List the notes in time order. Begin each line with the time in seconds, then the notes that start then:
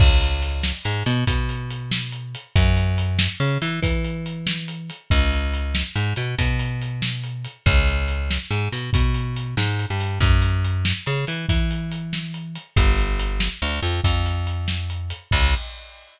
0.00 C#2, kick, crash
0.21 closed hi-hat
0.42 closed hi-hat
0.63 snare
0.85 G#2, closed hi-hat
1.06 B2, closed hi-hat
1.27 B2, kick, closed hi-hat
1.49 closed hi-hat
1.70 closed hi-hat
1.91 snare
2.12 closed hi-hat
2.35 closed hi-hat
2.56 F#2, kick, closed hi-hat
2.77 closed hi-hat
2.98 closed hi-hat
3.19 snare
3.40 C#3, closed hi-hat
3.62 E3, closed hi-hat
3.82 E3, kick, closed hi-hat
4.04 closed hi-hat
4.26 closed hi-hat
4.47 snare
4.68 closed hi-hat
4.90 closed hi-hat
5.10 C#2, kick, closed hi-hat
5.32 closed hi-hat
5.54 closed hi-hat
5.75 snare
5.96 G#2, closed hi-hat
6.16 B2, closed hi-hat
6.38 B2, kick, closed hi-hat
6.59 closed hi-hat
6.81 closed hi-hat
7.02 snare
7.24 closed hi-hat
7.45 closed hi-hat
7.66 C#2, kick, closed hi-hat
7.87 closed hi-hat
8.08 closed hi-hat
8.31 snare
8.51 G#2, closed hi-hat
8.72 B2, closed hi-hat
8.93 B2, kick, closed hi-hat
9.14 closed hi-hat
9.36 closed hi-hat
9.57 G#2, snare
9.79 closed hi-hat
9.90 G2
10.00 closed hi-hat
10.20 F#2, kick, closed hi-hat
10.42 closed hi-hat
10.64 closed hi-hat
10.85 snare
11.06 C#3, closed hi-hat
11.27 E3, closed hi-hat
11.49 E3, kick, closed hi-hat
11.71 closed hi-hat
11.91 closed hi-hat
12.13 snare
12.34 closed hi-hat
12.55 closed hi-hat
12.76 G1, kick, closed hi-hat
12.97 closed hi-hat
13.19 closed hi-hat
13.40 snare
13.62 D2, closed hi-hat
13.83 F2, closed hi-hat
14.04 F2, kick, closed hi-hat
14.26 closed hi-hat
14.47 closed hi-hat
14.68 snare
14.90 closed hi-hat
15.10 closed hi-hat
15.31 C#2, kick, crash